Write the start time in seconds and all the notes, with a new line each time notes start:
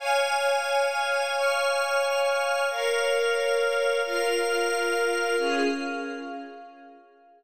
0.00 C#5 F5 G#5 F6
1.34 C#5 F5 G#5 C#6 F6
2.68 A#4 C#5 F5 F6
4.03 F4 A#4 F5 F6
5.37 C#4 F4 G#4 F5